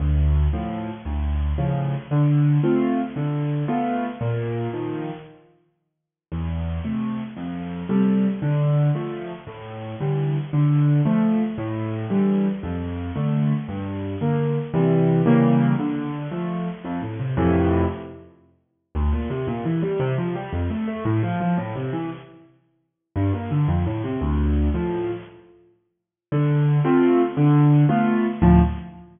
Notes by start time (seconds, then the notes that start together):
0.00 D2
0.53 A2 F3
1.05 D2
1.58 A2 C#3 F3
2.11 D3
2.63 A3 C4 F4
3.16 D3
3.68 A3 B3 F4
4.21 A#2
4.73 D#3 F3
6.32 E2
6.85 C3 A3
7.37 F2
7.89 C3 G3 A3
8.42 D3
8.95 F3 A3
9.47 A2
10.00 D3 E3 G3
10.53 D3
11.05 F3 A3
11.58 A2
12.10 D3 E3 G3
12.63 F2
13.16 D3 A3
13.68 G2
14.21 D3 A#3
14.74 C3 E3 G3
15.26 C#3 E3 G3 A#3
15.79 D3
16.31 F3 A3
16.85 F2
17.02 A2
17.20 C3
17.37 F2 A2 C3 E3
18.95 D2
19.12 A#2
19.30 C3
19.47 A#2
19.65 E3
19.82 G3
20.00 C3
20.18 F3
20.35 G3
20.52 F2
20.70 A3
20.88 A3
21.05 A2
21.23 F3
21.40 F3
21.58 A2
21.75 C3
21.93 E3
23.16 G2
23.33 A#2
23.51 D3
23.68 F2
23.86 A2
24.04 C3
24.21 D2
24.74 A2 F3
26.32 D3
26.85 A3 C4 F4
27.37 D3
27.89 A3 B3 F4
28.42 D2 A2 F3